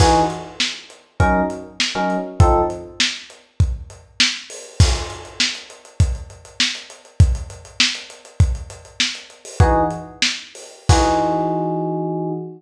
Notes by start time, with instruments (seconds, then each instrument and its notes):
0.00 electric piano 1 E3 D#4 F#4 G#4, kick, crash
0.30 closed hi-hat
0.60 snare
0.90 closed hi-hat
1.20 electric piano 1 F#3 C#4 D#4 A#4, kick, closed hi-hat
1.50 closed hi-hat
1.80 snare
1.95 electric piano 1 F#3 C#4 D#4 A#4
2.10 closed hi-hat
2.40 electric piano 1 F3 C4 D#4 A4, kick, closed hi-hat
2.70 closed hi-hat
3.00 snare
3.30 closed hi-hat
3.60 kick, closed hi-hat
3.90 closed hi-hat
4.20 snare
4.50 open hi-hat
4.80 kick, crash
4.95 closed hi-hat
5.10 closed hi-hat
5.25 closed hi-hat
5.40 snare
5.55 closed hi-hat
5.70 closed hi-hat
5.85 closed hi-hat
6.00 kick, closed hi-hat
6.15 closed hi-hat
6.30 closed hi-hat
6.45 closed hi-hat
6.60 snare
6.75 closed hi-hat
6.90 closed hi-hat
7.05 closed hi-hat
7.20 kick, closed hi-hat
7.35 closed hi-hat
7.50 closed hi-hat
7.65 closed hi-hat
7.80 snare
7.95 closed hi-hat
8.10 closed hi-hat
8.25 closed hi-hat
8.40 kick, closed hi-hat
8.55 closed hi-hat
8.70 closed hi-hat
8.85 closed hi-hat
9.00 snare
9.15 closed hi-hat
9.30 closed hi-hat
9.45 open hi-hat
9.60 electric piano 1 E3 D#4 F#4 G#4, kick, closed hi-hat
9.91 closed hi-hat
10.22 snare
10.55 open hi-hat
10.89 electric piano 1 E3 D#4 F#4 G#4, kick, crash